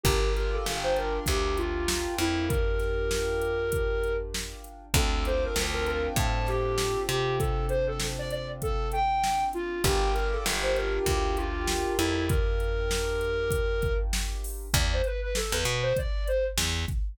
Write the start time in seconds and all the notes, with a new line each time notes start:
0.04 G1 D4 F4 G4 A#4, kick, closed hi-hat
0.35 A#4, closed hi-hat
0.53 A4
0.66 G1, snare
0.83 C5
0.96 A#4, closed hi-hat
1.26 D2 G4, kick, closed hi-hat
1.57 F4, closed hi-hat
1.88 snare
2.18 F2 E4, closed hi-hat
2.49 A#4, kick, closed hi-hat
2.80 snare, closed hi-hat
3.11 snare
3.42 closed hi-hat
3.72 kick, closed hi-hat
4.04 closed hi-hat
4.34 snare
4.64 closed hi-hat
4.94 D2 C4 D4 F4 A4, kick, closed hi-hat
5.25 C5, closed hi-hat
5.44 A#4
5.56 D2, snare
5.74 A#4
5.86 A#4, closed hi-hat
6.16 A2 A5, kick, closed hi-hat
6.47 G4, snare, closed hi-hat
6.78 snare
7.08 C3 G4, closed hi-hat
7.39 A4, kick, closed hi-hat
7.69 C5, closed hi-hat
7.87 A4
8.00 snare
8.19 D5
8.30 D5, closed hi-hat
8.62 A4, kick, closed hi-hat
8.92 G5, closed hi-hat
9.24 snare
9.53 F4, closed hi-hat
9.84 G1 D4 F4 G4 A#4, kick, closed hi-hat
10.14 A#4, closed hi-hat
10.33 A4
10.46 G1, snare
10.63 C5
10.76 A#4, closed hi-hat
11.06 D2 G4, kick, closed hi-hat
11.36 F4, closed hi-hat
11.68 snare
11.98 F2 E4, closed hi-hat
12.29 A#4, kick, closed hi-hat
12.60 closed hi-hat
12.91 snare
13.21 closed hi-hat
13.51 kick, closed hi-hat
13.82 kick, closed hi-hat
14.13 snare
14.44 open hi-hat
14.74 E2 D5, kick, closed hi-hat
14.93 C5
15.04 B4, closed hi-hat
15.21 B4
15.35 A4, snare
15.51 E2 B4
15.65 B2, closed hi-hat
15.83 C5
15.97 D5, kick, closed hi-hat
16.28 C5, closed hi-hat
16.58 E2, snare
16.88 kick, closed hi-hat